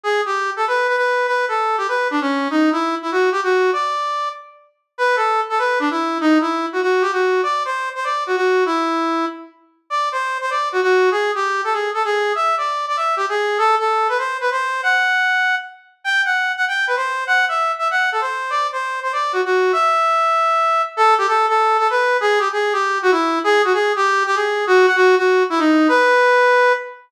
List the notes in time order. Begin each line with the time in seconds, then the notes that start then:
0.04 G#4
0.26 G4
0.56 A4
0.67 B4
0.88 B4
0.97 B4
1.27 B4
1.48 A4
1.78 G4
1.88 B4
2.11 D4
2.21 C#4
2.50 D#4
2.72 E4
3.02 E4
3.12 F#4
3.32 G4
3.43 F#4
3.73 D5
4.98 B4
5.16 A4
5.50 A4
5.59 B4
5.80 D4
5.91 E4
6.21 D#4
6.41 E4
6.73 F#4
6.82 F#4
7.02 G4
7.12 F#4
7.43 D5
7.65 C5
7.95 C5
8.04 D5
8.27 F#4
8.36 F#4
8.66 E4
9.90 D5
10.12 C5
10.41 C5
10.50 D5
10.72 F#4
10.82 F#4
11.11 G#4
11.35 G4
11.64 A4
11.73 G#4
11.94 A4
12.05 G#4
12.35 E5
12.57 D5
12.88 D5
12.97 E5
13.17 G4
13.29 G#4
13.58 A4
13.79 A4
14.09 B4
14.18 C5
14.41 B4
14.51 C5
14.83 F#5
16.04 G5
16.25 F#5
16.57 F#5
16.68 G5
16.87 B4
16.96 C5
17.27 F#5
17.49 E5
17.79 E5
17.91 F#5
18.12 A4
18.21 C5
18.50 D5
18.72 C5
19.03 C5
19.13 D5
19.33 F#4
19.45 F#4
19.73 E5
20.97 A4
21.18 G4
21.28 A4
21.48 A4
21.79 A4
21.90 B4
22.21 G#4
22.39 G4
22.53 G#4
22.73 G4
23.02 F#4
23.12 E4
23.44 G#4
23.64 F#4
23.74 G#4
23.96 G4
24.26 G4
24.35 G#4
24.67 F#4
24.86 F#5
24.96 F#4
25.18 F#4
25.50 E4
25.59 D#4
25.88 B4